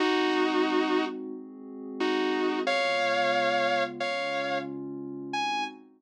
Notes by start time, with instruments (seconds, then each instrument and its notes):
0.00 pad 5 (bowed) G#3 C4 D#4 F#4, distortion guitar D#4 F#4
1.34 pad 5 (bowed) G#3 C4 F#4 G#4
2.00 distortion guitar D#4 F#4
2.67 pad 5 (bowed) C#3 G#3 B3 F4, distortion guitar C#5 F5
4.00 pad 5 (bowed) C#3 G#3 C#4 F4, distortion guitar C#5 F5
5.33 pad 5 (bowed) G#3 C4 D#4 F#4, distortion guitar G#5